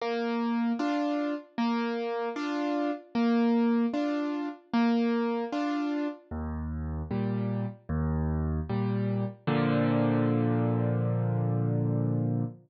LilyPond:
\new Staff { \time 4/4 \key bes \major \tempo 4 = 76 bes4 <d' f'>4 bes4 <d' f'>4 | bes4 <d' f'>4 bes4 <d' f'>4 | ees,4 <bes, g>4 ees,4 <bes, g>4 | <bes, d f>1 | }